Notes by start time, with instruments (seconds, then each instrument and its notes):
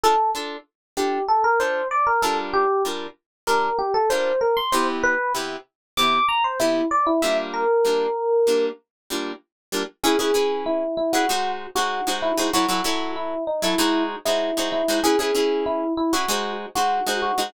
0.04 acoustic guitar (steel) D4 F4 A4, electric piano 1 A4
0.35 acoustic guitar (steel) D4 F4 A4
0.97 acoustic guitar (steel) D4 F4 A4, electric piano 1 G4
1.28 electric piano 1 A4
1.44 electric piano 1 A#4
1.60 acoustic guitar (steel) D4 F4 A4, electric piano 1 C5
1.91 electric piano 1 D5
2.07 electric piano 1 A#4
2.22 acoustic guitar (steel) G3 D4 F4 A#4, electric piano 1 A4
2.54 electric piano 1 G4
2.85 acoustic guitar (steel) G3 D4 F4 A#4
3.47 acoustic guitar (steel) G3 D4 F4 A#4, electric piano 1 A#4
3.79 electric piano 1 G4
3.94 electric piano 1 A4
4.10 acoustic guitar (steel) G3 D4 F4 A#4, electric piano 1 C5
4.41 electric piano 1 A#4
4.57 electric piano 1 C6
4.72 acoustic guitar (steel) C3 B3 E4 G4, electric piano 1 C5
5.03 electric piano 1 B4
5.35 acoustic guitar (steel) C3 B3 E4 G4
5.97 acoustic guitar (steel) C3 B3 E4 G4, electric piano 1 D6
6.29 electric piano 1 A#5
6.44 electric piano 1 C5
6.60 acoustic guitar (steel) C3 B3 E4 G4, electric piano 1 E4
6.91 electric piano 1 D5
7.07 electric piano 1 E4
7.22 acoustic guitar (steel) G3 A#3 D4 F4, electric piano 1 E5
7.54 electric piano 1 A#4
7.85 acoustic guitar (steel) G3 A#3 D4 F4
8.47 acoustic guitar (steel) G3 A#3 D4 F4
9.10 acoustic guitar (steel) G3 A#3 D4 F4
9.72 acoustic guitar (steel) G3 A#3 D4 F4
10.04 acoustic guitar (steel) C#4 E4 G#4 B4, electric piano 1 G#4
10.19 acoustic guitar (steel) C#4 E4 G#4 B4, electric piano 1 G#4
10.34 acoustic guitar (steel) C#4 E4 G#4 B4
10.66 electric piano 1 E4
10.97 electric piano 1 E4
11.13 acoustic guitar (steel) C#4 E4 G#4 B4, electric piano 1 F#4
11.29 acoustic guitar (steel) G#3 D#4 F#4 C5
11.75 acoustic guitar (steel) G#3 D#4 F#4 C5, electric piano 1 F#4
12.07 acoustic guitar (steel) G#3 D#4 F#4 C5
12.22 electric piano 1 E4
12.38 acoustic guitar (steel) G#3 D#4 F#4 C5
12.53 acoustic guitar (steel) F#3 E4 A4 C#5, electric piano 1 F#4
12.68 acoustic guitar (steel) F#3 E4 A4 C#5, electric piano 1 F#4
12.84 acoustic guitar (steel) F#3 E4 A4 C#5
13.16 electric piano 1 E4
13.47 electric piano 1 D#4
13.62 acoustic guitar (steel) F#3 E4 A4 C#5, electric piano 1 E4
13.78 acoustic guitar (steel) G#3 D#4 F#4 C5
14.25 acoustic guitar (steel) G#3 D#4 F#4 C5, electric piano 1 E4
14.57 acoustic guitar (steel) G#3 D#4 F#4 C5
14.72 electric piano 1 E4
14.88 acoustic guitar (steel) G#3 D#4 F#4 C5
15.04 acoustic guitar (steel) C#4 E4 G#4 B4, electric piano 1 G#4
15.19 acoustic guitar (steel) C#4 E4 G#4 B4, electric piano 1 G#4
15.35 acoustic guitar (steel) C#4 E4 G#4 B4
15.66 electric piano 1 E4
15.97 electric piano 1 E4
16.13 acoustic guitar (steel) C#4 E4 G#4 B4, electric piano 1 F#4
16.28 acoustic guitar (steel) G#3 D#4 F#4 C5
16.75 acoustic guitar (steel) G#3 D#4 F#4 C5, electric piano 1 F#4
17.07 acoustic guitar (steel) G#3 D#4 F#4 C5
17.22 electric piano 1 F#4
17.38 acoustic guitar (steel) G#3 D#4 F#4 C5